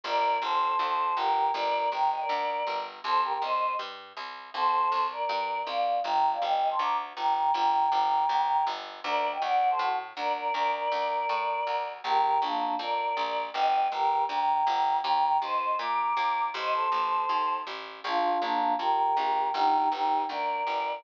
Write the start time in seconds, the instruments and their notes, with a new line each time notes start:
0.04 electric bass (finger) G1, choir aahs A#4 D5
0.42 electric bass (finger) G1, choir aahs A4 C5
0.79 electric bass (finger) D2
1.16 electric bass (finger) G1, choir aahs G4 A#4
1.54 electric bass (finger) G1, choir aahs A#4 D5
1.92 electric bass (finger) G1, choir aahs G5 A#5
2.11 choir aahs D#5 G5
2.20 choir aahs A#4 D5
2.29 electric bass (finger) D2
2.67 electric bass (finger) G1
3.04 electric bass (finger) C2, choir aahs A4 C5
3.24 choir aahs G4 A#4
3.33 choir aahs G4 A#4
3.42 electric bass (finger) C2, choir aahs C5 D#5
3.79 electric bass (finger) G2
4.17 electric bass (finger) C2
4.54 electric bass (finger) C2, choir aahs A4 C5
4.92 electric bass (finger) C2
5.11 choir aahs A#4 D5
5.29 electric bass (finger) G2
5.67 electric bass (finger) C2, choir aahs D5 F5
6.04 electric bass (finger) G1, choir aahs G5 A#5
6.32 choir aahs D5 F5
6.42 electric bass (finger) G1, choir aahs D#5 G5
6.70 choir aahs A5 C6
6.79 electric bass (finger) D2, choir aahs A#5 D6
7.16 electric bass (finger) G1, choir aahs G5 A#5
7.35 choir aahs G5 A#5
7.54 electric bass (finger) G1, choir aahs G5 A#5
7.92 electric bass (finger) G1
8.29 electric bass (finger) D2
8.67 electric bass (finger) G1
9.04 electric bass (finger) D2, choir aahs A#4 D5
9.32 choir aahs D#5 G5
9.42 electric bass (finger) D2, choir aahs D5 F#5
9.70 choir aahs A4 C5
9.79 electric bass (finger) A2, choir aahs F#4 A4
10.17 electric bass (finger) D2, choir aahs A#4 D5
10.36 choir aahs A#4 D5
10.53 electric bass (finger) D2, choir aahs A#4 D5
10.73 choir aahs A#4 D5
10.92 electric bass (finger) D2
11.29 electric bass (finger) A2
11.67 electric bass (finger) D2
12.04 electric bass (finger) A#1, choir aahs G4 A#4
12.42 electric bass (finger) A#1, choir aahs A#3 D4
12.79 electric bass (finger) F2, choir aahs A#4 D5
13.17 electric bass (finger) A#1
13.53 electric bass (finger) G1, choir aahs D#5 G5
13.92 electric bass (finger) G1, choir aahs G4 A#4
14.29 electric bass (finger) D2, choir aahs G5 A#5
14.67 electric bass (finger) G1
15.04 electric bass (finger) D#2, choir aahs G5 A#5
15.42 electric bass (finger) D#2, choir aahs C5 D#5
15.79 electric bass (finger) A#2, choir aahs A#5 D6
16.17 electric bass (finger) D#2
16.54 electric bass (finger) A1, choir aahs C5 D#5
16.73 choir aahs A4 C5
16.92 electric bass (finger) A1
17.29 electric bass (finger) D#2
17.67 electric bass (finger) A1
18.04 electric bass (finger) A#1, choir aahs D4 F4
18.41 electric bass (finger) A#1, choir aahs A#3 D4
18.79 electric bass (finger) F2, choir aahs G4 A#4
19.17 electric bass (finger) A#1
19.54 electric bass (finger) G1, choir aahs D#4 G4
19.91 electric bass (finger) G1, choir aahs D#4 G4
20.29 electric bass (finger) D2, choir aahs A#4 D5
20.67 electric bass (finger) G1